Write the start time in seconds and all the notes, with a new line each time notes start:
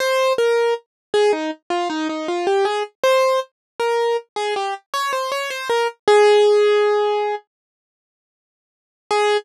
0.00 C5
0.38 A#4
1.14 G#4
1.33 D#4
1.70 F4
1.90 D#4
2.09 D#4
2.28 F4
2.47 G4
2.65 G#4
3.03 C5
3.80 A#4
4.36 G#4
4.56 G4
4.94 C#5
5.13 C5
5.32 C#5
5.50 C5
5.69 A#4
6.08 G#4
9.11 G#4